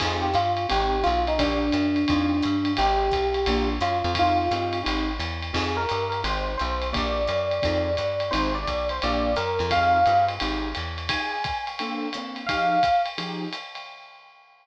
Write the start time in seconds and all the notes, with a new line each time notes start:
0.00 F2 C4 D#4 F4 G#4, kick, crash, ride
0.22 G4
0.34 G2 F4, hi-hat pedal, ride
0.57 ride
0.69 G#1 C4 D#4 G4 G#4, ride
1.03 B1 F4, hi-hat pedal, ride
1.27 D#4, ride
1.38 A#1 A#3 D4 F4 G4, kick, ride
1.72 F#2, hi-hat pedal, ride
1.96 ride
2.08 F2 C4 D#4 F4 G#4, kick, ride
2.42 G2, hi-hat pedal, ride
2.65 ride
2.77 G#1 C4 D#4 G4 G#4, ride
3.11 B1, kick, hi-hat pedal, ride
3.34 ride
3.46 A#1 A#3 D4 F4 G4, ride
3.81 F#2 F4, hi-hat pedal, ride
4.04 F2, ride
4.15 C4 D#4 F4 G#4, kick, ride
4.19 F4
4.51 G2 C4 D#4 F4 G#4, hi-hat pedal, ride
4.73 ride
4.83 G#1 C4 D#4 G4 G#4, ride
5.19 E2, hi-hat pedal, ride
5.42 ride
5.53 F2 C4 D#4 F4 G#4, kick, crash, ride
5.77 A#4
5.89 G2, hi-hat pedal, ride
6.10 A#4, ride
6.24 G#1 C4 D#4 G4 G#4 C5, ride
6.58 B1 C5, hi-hat pedal, ride
6.82 ride
6.92 A#1 A#3 D4 F4 G4 D5, kick, ride
7.27 F#2, hi-hat pedal, ride
7.51 ride
7.63 F2 C4 D#4 F4 G#4, kick, ride
7.97 G2, hi-hat pedal, ride
8.20 ride
8.31 G#1 C4 D#4 G4 G#4 C5, ride
8.55 D5
8.67 B1, kick, hi-hat pedal, ride
8.89 C5, ride
9.02 A#1 A#3 D4 F4 G4 D5, ride
9.36 F#2 A#4, hi-hat pedal, ride
9.59 F2, ride
9.71 C4 D#4 F4 G#4 F5, kick, ride
10.06 G2 C4 D#4 F4 G#4, hi-hat pedal, ride
10.29 ride
10.40 G#1 C4 D#4 G4 G#4, ride
10.75 E2, hi-hat pedal, ride
10.98 ride
11.09 F3 D#4 G4 G#4 G#5, kick, ride
11.44 kick, hi-hat pedal, ride
11.67 ride
11.79 A#3 C4 D4 A4, ride
12.13 A#3 C4 D4 A4, hi-hat pedal, ride
12.36 ride
12.46 F3 D#4 G4 G#4 F5, kick, ride
12.83 kick, hi-hat pedal, ride
13.06 ride
13.18 F3 D#4 G4 G#4, ride
13.53 hi-hat pedal, ride
13.75 ride